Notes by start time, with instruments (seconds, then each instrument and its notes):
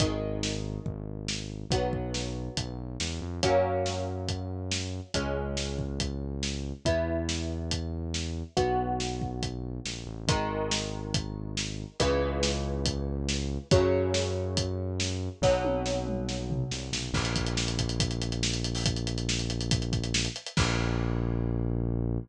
0.00 synth bass 1 G#1, acoustic guitar (steel) D#3 G#3, kick, closed hi-hat
0.43 snare
0.86 synth bass 1 G#1, kick
1.28 snare
1.70 synth bass 1 B1, acoustic guitar (steel) F#3 B3, kick, closed hi-hat
1.93 kick
2.14 snare
2.57 synth bass 1 B1, kick, closed hi-hat
3.00 synth bass 1 E2, snare
3.21 synth bass 1 F2
3.43 synth bass 1 F#2, acoustic guitar (steel) F#3 A#3 C#4, kick, closed hi-hat
3.86 snare
4.28 kick, closed hi-hat
4.71 snare
5.14 synth bass 1 C#2, acoustic guitar (steel) G#3 C#4, kick, closed hi-hat
5.57 snare
5.79 kick
6.00 kick, closed hi-hat
6.43 snare
6.85 synth bass 1 E2, acoustic guitar (steel) B3 E4, kick, closed hi-hat
7.29 snare
7.71 kick, closed hi-hat
8.14 snare
8.57 synth bass 1 B1, acoustic guitar (steel) B3 F#4, kick, closed hi-hat
9.00 snare
9.22 kick
9.43 kick, closed hi-hat
9.85 synth bass 1 A#1, snare
10.07 synth bass 1 A1
10.27 synth bass 1 G#1, acoustic guitar (steel) D#3 G#3, kick, closed hi-hat
10.71 snare
11.14 kick, closed hi-hat
11.57 snare
12.00 synth bass 1 C#2, acoustic guitar (steel) C#3 E3 G#3, kick, closed hi-hat
12.43 snare
12.86 kick, closed hi-hat
13.29 snare
13.71 synth bass 1 F#2, acoustic guitar (steel) C#3 F#3, kick, closed hi-hat
14.14 snare
14.57 kick, closed hi-hat
15.00 snare
15.42 synth bass 1 B1, acoustic guitar (steel) B2 F#3, kick, snare
15.64 high tom
15.86 snare
16.07 mid tom
16.29 snare
16.50 floor tom
16.71 synth bass 1 C2, snare
16.92 synth bass 1 B1, snare
17.13 synth bass 1 A#1, kick, crash
17.25 closed hi-hat
17.36 kick, closed hi-hat
17.47 closed hi-hat
17.57 snare
17.68 closed hi-hat
17.78 kick, closed hi-hat
17.89 closed hi-hat
18.00 kick, closed hi-hat
18.11 closed hi-hat
18.22 closed hi-hat
18.32 closed hi-hat
18.43 snare
18.54 closed hi-hat
18.64 closed hi-hat
18.75 open hi-hat
18.86 kick, closed hi-hat
18.96 closed hi-hat
19.07 closed hi-hat
19.18 closed hi-hat
19.29 snare
19.39 closed hi-hat
19.50 closed hi-hat
19.61 closed hi-hat
19.71 kick, closed hi-hat
19.82 closed hi-hat
19.93 kick, closed hi-hat
20.04 closed hi-hat
20.14 snare
20.25 closed hi-hat
20.36 closed hi-hat
20.46 closed hi-hat
20.57 synth bass 1 A#1, kick, crash